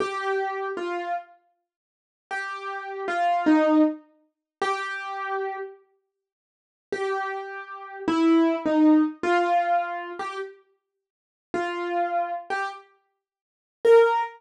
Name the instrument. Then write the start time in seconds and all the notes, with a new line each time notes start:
acoustic grand piano
0.00 G4
0.77 F4
2.31 G4
3.08 F4
3.46 D#4
4.61 G4
6.92 G4
8.08 E4
8.65 D#4
9.23 F4
10.19 G4
11.54 F4
12.50 G4
13.85 A#4